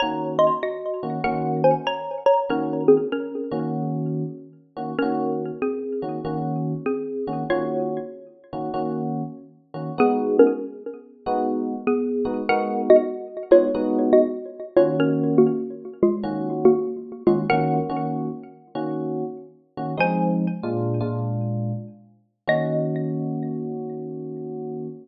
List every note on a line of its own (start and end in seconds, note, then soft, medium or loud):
0.00 0.51 D#3 loud
0.00 0.51 A#3 medium
0.00 0.51 C#4 medium
0.00 0.51 F#4 medium
0.00 0.34 C#5 medium
0.00 0.34 A#5 medium
0.39 0.59 D#5 medium
0.39 0.59 C6 medium
0.63 1.23 F#4 medium
0.63 1.23 D#5 medium
1.03 1.19 D#3 medium
1.03 1.19 A#3 medium
1.03 1.19 C#4 medium
1.03 1.19 F#4 medium
1.24 1.73 D#3 medium
1.24 1.73 A#3 loud
1.24 1.73 C#4 loud
1.24 1.73 F#4 loud
1.24 1.61 A#4 medium
1.24 1.61 F#5 medium
1.64 1.86 C5 medium
1.64 1.86 G#5 medium
1.87 2.24 C#5 medium
1.87 2.24 A#5 medium
2.26 2.45 C#5 medium
2.26 2.45 A#5 medium
2.49 2.98 D#3 loud
2.49 2.98 A#3 medium
2.49 2.98 C#4 medium
2.49 2.83 C#4 medium
2.49 2.98 F#4 medium
2.49 2.83 A#4 medium
2.88 3.09 C4 medium
2.88 3.09 G#4 medium
3.12 4.41 C#4 medium
3.12 4.41 A#4 medium
3.51 4.23 D#3 loud
3.51 4.23 A#3 loud
3.51 4.23 C#4 loud
3.51 4.23 F#4 medium
4.77 4.93 D#3 medium
4.77 4.93 A#3 medium
4.77 4.93 C#4 medium
4.77 4.93 F#4 medium
4.99 5.51 D#3 loud
4.99 5.51 A#3 medium
4.99 5.54 C#4 medium
4.99 5.51 C#4 medium
4.99 5.51 F#4 loud
4.99 5.54 A#4 medium
5.62 6.72 C4 medium
5.62 6.72 G#4 medium
6.02 6.19 D#3 medium
6.02 6.19 A#3 medium
6.02 6.19 C#4 medium
6.02 6.19 F#4 medium
6.25 6.73 D#3 loud
6.25 6.73 A#3 medium
6.25 6.73 C#4 loud
6.25 6.73 F#4 medium
6.86 7.48 C4 medium
6.86 7.48 G#4 medium
7.27 7.44 D#3 medium
7.27 7.44 A#3 medium
7.27 7.44 C#4 medium
7.27 7.44 F#4 medium
7.50 7.99 D#3 medium
7.50 7.99 A#3 medium
7.50 7.99 C#4 loud
7.50 8.67 F4 medium
7.50 7.99 F#4 loud
7.50 8.67 C#5 medium
8.53 8.69 D#3 medium
8.53 8.69 A#3 medium
8.53 8.69 C#4 medium
8.53 8.69 F#4 medium
8.74 9.22 D#3 medium
8.74 9.22 A#3 loud
8.74 9.22 C#4 medium
8.74 9.22 F#4 loud
9.74 9.90 D#3 medium
9.74 9.90 A#3 medium
9.74 9.90 C#4 medium
9.74 9.90 F#4 medium
9.98 10.47 G#3 loud
9.98 10.47 B3 loud
9.98 10.36 B3 medium
9.98 10.47 D#4 loud
9.98 10.47 F#4 loud
9.98 10.36 G#4 loud
10.39 10.62 C#4 medium
10.39 10.62 A#4 medium
11.26 11.75 G#3 loud
11.26 11.75 B3 loud
11.26 11.75 D#4 medium
11.26 11.75 F#4 loud
11.87 12.43 B3 medium
11.87 12.43 G#4 medium
12.25 12.41 G#3 medium
12.25 12.41 B3 medium
12.25 12.41 D#4 medium
12.25 12.41 F#4 medium
12.49 12.98 G#3 loud
12.49 12.98 B3 loud
12.49 12.98 D#4 loud
12.49 12.98 F#4 loud
12.49 12.82 A#4 medium
12.49 12.82 F#5 medium
12.90 13.38 F#4 medium
12.90 13.38 D#5 medium
13.51 13.67 G#3 medium
13.51 13.67 B3 medium
13.51 13.67 D#4 medium
13.51 14.01 F4 medium
13.51 13.67 F#4 medium
13.51 14.01 C#5 medium
13.75 14.23 G#3 loud
13.75 14.23 B3 loud
13.75 14.23 D#4 loud
13.75 14.23 F#4 loud
14.13 14.70 F#4 medium
14.13 14.70 D#5 medium
14.77 15.49 D#3 loud
14.77 15.49 A#3 loud
14.77 15.49 C#4 loud
14.77 14.96 F4 medium
14.77 15.49 F#4 loud
14.77 14.96 C#5 medium
15.00 15.38 C#4 medium
15.00 15.38 A#4 medium
15.38 15.86 A#3 medium
15.38 15.86 F#4 medium
16.03 16.51 G#3 medium
16.03 16.51 F4 medium
16.23 16.72 D#3 loud
16.23 16.72 A#3 medium
16.23 16.72 C#4 loud
16.23 16.72 F#4 loud
16.65 17.23 A#3 medium
16.65 17.23 F#4 medium
17.27 17.43 D#3 medium
17.27 17.48 G#3 medium
17.27 17.43 A#3 medium
17.27 17.43 C#4 medium
17.27 17.48 F4 medium
17.27 17.43 F#4 medium
17.50 17.79 D#3 loud
17.50 17.79 A#3 loud
17.50 17.79 C#4 loud
17.50 17.79 F#4 loud
17.50 18.05 A#4 medium
17.50 18.05 F#5 medium
17.90 18.29 D#3 loud
17.90 18.29 A#3 medium
17.90 18.29 C#4 loud
17.90 18.29 F#4 loud
18.75 19.24 D#3 loud
18.75 19.24 A#3 loud
18.75 19.24 C#4 loud
18.75 19.24 F#4 loud
19.77 19.94 D#3 medium
19.77 19.94 A#3 medium
19.77 19.94 C#4 medium
19.77 19.94 F#4 medium
19.98 20.46 F3 loud
19.98 20.46 G#3 loud
19.98 20.46 C4 loud
19.98 20.46 D#4 loud
19.98 22.36 C5 medium
19.98 22.36 G#5 medium
20.63 21.00 A#2 loud
20.63 21.00 G#3 loud
20.63 21.00 D4 medium
20.63 21.00 F4 loud
21.01 21.72 A#2 loud
21.01 21.72 G#3 medium
21.01 21.72 D4 loud
21.01 21.72 F4 loud
22.48 24.87 D#3 loud
22.48 24.87 A#3 medium
22.48 24.87 C#4 loud
22.48 24.87 F#4 loud
22.48 24.89 D#5 loud